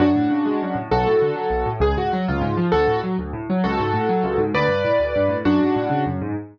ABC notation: X:1
M:6/8
L:1/8
Q:3/8=132
K:F#m
V:1 name="Acoustic Grand Piano"
[DF]6 | [FA]6 | G F F ^E3 | [FA]2 z4 |
[FA]6 | [Bd]6 | [DF]4 z2 |]
V:2 name="Acoustic Grand Piano" clef=bass
F,, A,, C, G, F,, A,, | B,,, A,, D, F, B,,, A,, | C,, G,, F, C,, G,, ^E, | D,, A,, F, D,, A,, F, |
C,, G,, A,, F, C,, G,, | D,, =G,, A,, D,, G,, A,, | F,, G,, A,, C, F,, G,, |]